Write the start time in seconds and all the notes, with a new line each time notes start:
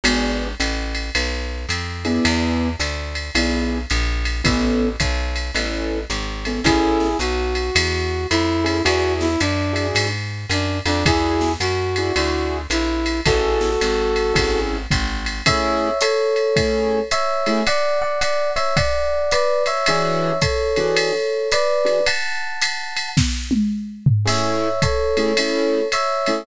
0.04 G#1 B3 D4 F#4 G#4, ride
0.60 A1, hi-hat pedal, ride
0.95 ride
1.15 B1, ride
1.69 F2, hi-hat pedal, ride
2.05 B3 D4 E4 G#4, ride
2.25 E2, ride
2.80 D2, hi-hat pedal, ride
3.15 ride
3.35 B1 B3 D4 E4 G#4, ride
3.90 A#1, hi-hat pedal, ride
4.25 ride
4.44 A1 B3 C#4 E4 A4, kick, ride
5.00 B1, kick, hi-hat pedal, ride
5.36 ride
5.55 A1 B3 C#4 E4 A4, ride
6.10 G#1, hi-hat pedal, ride
6.45 B3 C#4 E4 A4, ride
6.64 A1 C#4 E4 G#4 A4, kick, ride
7.00 snare
7.19 B1 F#4, hi-hat pedal, ride
7.55 ride
7.75 E2, ride
8.30 F2 E4, hi-hat pedal, ride
8.64 C#4 E4 G#4 A4, ride
8.85 E2 D4 E4 F#4 G#4, ride
9.21 E4, snare
9.40 F#2 D4, hi-hat pedal, ride
9.73 D4 E4 F#4 G#4, ride
9.95 G#2, ride
10.49 F#2 D4, hi-hat pedal, ride
10.86 F2 D4, ride
11.05 E2 D4 E4 F#4 G#4, kick, ride
11.41 snare
11.60 F#2 F#4, hi-hat pedal, ride
11.96 D4 E4 F#4 G#4, ride
12.16 D2 D4 E4 F#4 G#4, ride
12.70 A#1 E4, hi-hat pedal, ride
13.06 ride
13.25 A1 C#4 E4 F#4 G#4 A4, kick, ride
13.61 snare
13.81 G#1, hi-hat pedal, ride
14.16 ride
14.34 G#1 C#4 E4 G#4 A4, kick, ride
14.91 G#1, kick, hi-hat pedal, ride
15.26 ride
15.46 A3 C#4 E4 G#4 C#5 E5, kick, ride
16.01 A4 C#5, hi-hat pedal, ride
16.36 ride
16.56 A3 C#4 E4 G#4, kick, ride
17.11 C#5 E5, hi-hat pedal, ride
17.46 A3 C#4 E4 G#4, ride
17.67 D5 F#5, ride
18.02 D5 F#5
18.21 D5 F#5, hi-hat pedal, ride
18.56 C#5 E5, ride
18.77 D5 F#5, kick, ride
19.31 B4 D5, hi-hat pedal, ride
19.66 C#5 E5, ride
19.86 E3 D4 F#4 G#4 C#5 E5, ride
20.42 A4 C#5, kick, hi-hat pedal, ride
20.76 E3 D4 F#4 G#4, ride
20.97 ride
21.52 B4 D5, hi-hat pedal, ride
21.85 E3 D4 F#4 G#4, ride
22.06 F#5 A5, ride
22.61 hi-hat pedal, ride
22.97 ride
23.17 kick, snare
23.51 high tom
24.06 floor tom
24.25 A3 C#4 E4 G#4 C#5 E5, crash, ride
24.82 A4 C#5, kick, hi-hat pedal, ride
25.17 A3 C#4 E4 G#4, ride
25.37 A3 C#4 E4 G#4, ride
25.92 C#5 E5, hi-hat pedal, ride
26.26 A3 C#4 E4 G#4, ride